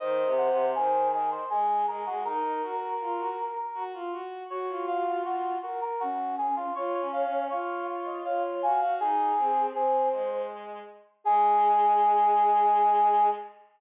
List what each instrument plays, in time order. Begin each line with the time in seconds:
0.00 violin D#3, flute C5, brass section D#5
0.25 violin C3
0.38 brass section F#5
0.49 violin C3
0.75 violin D#3, brass section G#4, flute C5
1.12 brass section G#4, flute D#5
1.31 brass section C5
1.50 violin G#3, brass section G#4, flute G#4
1.88 violin G#3, brass section A#4
2.06 violin G#3, brass section F#4
2.24 violin D#4, flute A#4, brass section A#4
2.44 violin D#4
2.62 violin F#4
2.80 flute A#4
3.00 violin F4
3.19 violin F#4
3.74 violin F#4
3.94 violin F4
4.12 violin F#4
4.50 violin F#4, flute F#4, brass section C#5
4.69 violin F4
4.88 brass section F5
5.24 flute F#4, brass section F#4
5.62 brass section F#4, flute A#4
5.81 brass section A#4
6.00 flute C#4, brass section F#4
6.38 brass section G#4
6.56 brass section F4
6.75 violin F4, brass section C#5, flute C#5
6.94 brass section C#5
7.00 violin C#4
7.12 brass section F5
7.25 violin C#4
7.50 violin F4, brass section C#5, flute F5
8.05 flute D#5
8.24 violin F4, flute C#5, brass section F5
8.62 violin F#4, flute F5, brass section G#5
8.81 violin F#4, brass section F5
9.00 violin D#4, flute G#4, brass section G#4
9.38 violin C4
9.73 violin C4, brass section G#4, flute C5
10.13 violin G#3
11.24 violin G#3, flute G#4, brass section G#4